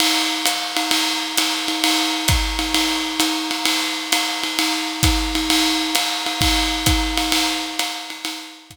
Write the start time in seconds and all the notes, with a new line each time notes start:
0.00 ride
0.46 hi-hat pedal, ride
0.77 ride
0.91 ride
1.37 hi-hat pedal, ride
1.68 ride
1.84 ride
2.28 kick, hi-hat pedal, ride
2.59 ride
2.74 ride
3.20 hi-hat pedal, ride
3.51 ride
3.65 ride
4.12 hi-hat pedal, ride
4.43 ride
4.59 ride
5.03 kick, hi-hat pedal, ride
5.35 ride
5.50 ride
5.95 hi-hat pedal, ride
6.26 ride
6.41 kick, ride
6.86 kick, hi-hat pedal, ride
7.17 ride
7.32 ride
7.79 hi-hat pedal, ride
8.10 ride
8.25 ride
8.70 kick, hi-hat pedal, ride